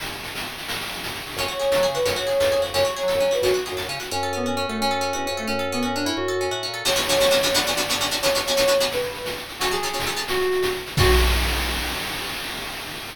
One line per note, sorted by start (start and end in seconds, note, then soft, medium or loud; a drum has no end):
0.00 shaker medium
0.06 shaker medium
0.12 shaker medium
0.17 shaker medium
0.23 shaker medium
0.28 shaker medium
0.35 shaker medium
0.40 shaker medium
0.46 shaker medium
0.52 shaker medium
0.58 shaker medium
0.63 shaker medium
0.68 shaker loud
0.75 shaker medium
0.81 shaker medium
0.86 shaker medium
0.92 shaker medium
0.97 shaker medium
1.03 shaker medium
1.08 shaker medium
1.14 shaker medium
1.20 shaker medium
1.26 shaker medium
1.31 shaker medium
1.36 1.47 F#2 medium
1.36 1.49 C#4 medium
1.36 1.89 C#5 medium
1.36 shaker medium
1.48 1.58 F#4 medium
1.48 shaker medium
1.59 1.70 G#4 medium
1.59 shaker medium
1.72 1.82 A4 medium
1.72 shaker loud
1.76 1.86 F#3 medium
1.82 1.93 G#4 medium
1.82 shaker medium
1.88 1.98 C#3 medium
1.94 2.05 F#4 medium
1.94 2.05 B4 loud
1.94 shaker medium
2.05 2.16 F#2 medium
2.05 2.16 C#4 medium
2.05 2.63 C#5 loud
2.05 shaker medium
2.16 2.27 F#4 medium
2.16 shaker medium
2.27 2.37 G#4 medium
2.27 shaker medium
2.40 2.55 E2 medium
2.40 2.51 A4 medium
2.40 shaker loud
2.52 2.62 G#4 medium
2.52 shaker medium
2.58 2.73 F2 medium
2.62 2.72 F#4 medium
2.62 shaker medium
2.74 2.84 F#2 medium
2.74 2.84 C#4 medium
2.74 3.31 C#5 loud
2.74 shaker medium
2.85 2.95 F#4 medium
2.85 shaker medium
2.96 3.07 G#4 medium
2.96 shaker medium
3.03 3.13 F#3 medium
3.08 3.18 A4 medium
3.08 shaker medium
3.14 3.20 F#2 medium
3.20 3.30 F#3 medium
3.20 3.31 C#4 medium
3.20 shaker medium
3.31 3.41 F#4 medium
3.31 3.42 B4 medium
3.31 shaker medium
3.42 3.52 F#2 medium
3.42 3.53 C#4 medium
3.42 3.70 F#4 loud
3.42 shaker medium
3.54 3.64 F#4 medium
3.54 shaker medium
3.66 3.76 G#4 medium
3.66 shaker medium
3.72 3.82 F#2 medium
3.77 3.87 A4 medium
3.77 shaker medium
3.83 3.88 F#2 medium
3.88 3.99 C#3 medium
3.88 3.99 C#4 medium
3.88 shaker medium
3.99 4.10 F#4 medium
3.99 shaker medium
4.11 4.66 F#2 medium
4.11 4.32 C#4 medium
4.11 4.34 C#4 medium
4.23 4.69 A4 medium
4.33 4.46 B3 medium
4.33 4.56 C#4 medium
4.46 4.55 C#4 medium
4.46 4.78 F#4 medium
4.56 4.66 C#4 medium
4.56 4.79 C#4 medium
4.68 5.13 F#2 medium
4.68 4.79 A3 medium
4.68 4.80 A4 medium
4.80 5.12 C#4 medium
4.80 5.01 C#4 medium
4.91 5.37 A4 medium
5.01 5.27 C#4 medium
5.13 5.30 E2 medium
5.13 5.24 C#4 medium
5.13 5.46 F#4 medium
5.25 5.34 C#4 medium
5.25 5.47 C#4 medium
5.31 5.46 F2 medium
5.37 5.48 A3 medium
5.37 5.48 A4 medium
5.47 6.12 F#2 medium
5.47 5.67 C#4 medium
5.47 5.72 C#4 medium
5.59 6.13 A4 medium
5.72 5.83 B3 medium
5.72 5.95 C#4 medium
5.83 5.95 C#4 medium
5.83 6.15 F#4 medium
5.95 6.06 C#4 medium
5.95 6.06 D4 medium
6.05 6.40 C#4 medium
6.05 6.16 E4 medium
6.17 6.50 F#2 medium
6.17 6.45 F#4 medium
6.28 6.73 A4 medium
6.41 6.63 C#4 medium
6.51 6.67 A2 medium
6.51 6.84 F#4 medium
6.63 6.85 C#4 medium
6.67 6.83 A#2 soft
6.74 6.85 A4 medium
6.85 6.90 B3 medium
6.85 6.90 C#4 medium
6.85 6.90 D4 medium
6.85 6.90 F#4 medium
6.85 7.53 C#5 loud
6.85 crash medium
6.96 7.00 B3 medium
6.96 7.00 C#4 medium
6.96 7.00 D4 medium
6.96 7.00 F#4 medium
6.96 shaker medium
7.09 7.14 B3 medium
7.09 7.14 C#4 medium
7.09 7.14 D4 medium
7.09 7.14 F#4 medium
7.09 shaker medium
7.20 7.25 B3 medium
7.20 7.25 C#4 medium
7.20 7.25 D4 medium
7.20 7.25 F#4 medium
7.20 shaker medium
7.31 7.35 B3 medium
7.31 7.35 C#4 medium
7.31 7.35 D4 medium
7.31 7.35 F#4 medium
7.31 shaker medium
7.43 7.48 B3 medium
7.43 7.48 C#4 medium
7.43 7.48 D4 medium
7.43 7.48 F#4 medium
7.43 shaker medium
7.54 7.59 B3 loud
7.54 7.59 C#4 medium
7.54 7.59 D4 loud
7.54 7.59 F#4 medium
7.54 8.13 D5 loud
7.54 shaker medium
7.66 7.71 B3 medium
7.66 7.71 C#4 medium
7.66 7.71 D4 medium
7.66 7.71 F#4 medium
7.66 shaker medium
7.77 7.82 B3 medium
7.77 7.82 C#4 medium
7.77 7.82 D4 medium
7.77 7.82 F#4 medium
7.77 shaker medium
7.88 7.94 B3 medium
7.88 7.94 C#4 medium
7.88 7.94 D4 medium
7.88 7.94 F#4 medium
7.88 shaker medium
8.00 8.05 B3 medium
8.00 8.05 C#4 medium
8.00 8.05 D4 medium
8.00 8.05 F#4 medium
8.00 shaker medium
8.11 8.16 B3 medium
8.11 8.16 C#4 medium
8.11 8.16 D4 medium
8.11 8.16 F#4 medium
8.11 shaker medium
8.22 8.27 B3 medium
8.22 8.27 C#4 medium
8.22 8.27 D4 medium
8.22 8.27 F#4 medium
8.22 8.83 C#5 loud
8.22 shaker medium
8.35 8.39 B3 medium
8.35 8.39 C#4 medium
8.35 8.39 D4 medium
8.35 8.39 F#4 medium
8.35 shaker medium
8.46 8.52 B3 medium
8.46 8.52 C#4 medium
8.46 8.52 D4 medium
8.46 8.52 F#4 medium
8.46 shaker medium
8.57 8.62 B3 medium
8.57 8.62 C#4 medium
8.57 8.62 D4 medium
8.57 8.62 F#4 medium
8.57 shaker medium
8.68 8.72 B3 medium
8.68 8.72 C#4 medium
8.68 8.72 D4 medium
8.68 8.72 F#4 medium
8.68 shaker medium
8.80 8.85 B3 medium
8.80 8.85 C#4 medium
8.80 8.85 D4 medium
8.80 8.85 F#4 medium
8.80 shaker medium
8.91 9.25 B4 medium
8.91 shaker medium
9.02 shaker medium
9.14 shaker medium
9.25 shaker medium
9.37 shaker medium
9.48 shaker medium
9.59 9.66 F#3 medium
9.59 9.66 C#4 medium
9.59 9.69 F#4 medium
9.59 9.66 A4 medium
9.59 shaker loud
9.71 9.76 F#3 medium
9.71 9.76 C#4 medium
9.71 10.23 G#4 medium
9.71 9.76 A4 medium
9.71 shaker medium
9.83 9.88 F#3 medium
9.83 9.88 C#4 medium
9.83 9.88 A4 medium
9.83 shaker medium
9.93 9.98 F#3 medium
9.93 9.98 C#4 medium
9.93 9.98 A4 medium
9.99 shaker loud
10.05 10.11 F#3 medium
10.05 10.11 C#4 medium
10.05 10.11 A4 medium
10.05 shaker medium
10.16 10.21 F#3 medium
10.16 10.21 C#4 medium
10.16 10.21 A4 medium
10.16 shaker medium
10.28 10.66 F#4 medium
10.28 shaker loud
10.39 shaker medium
10.52 shaker medium
10.62 shaker medium
10.75 shaker medium
10.86 shaker medium
10.97 11.09 C#4 medium
10.97 11.09 F#4 medium
10.97 11.10 F#4 loud
10.97 11.09 A4 medium
10.97 kick loud
10.97 crash loud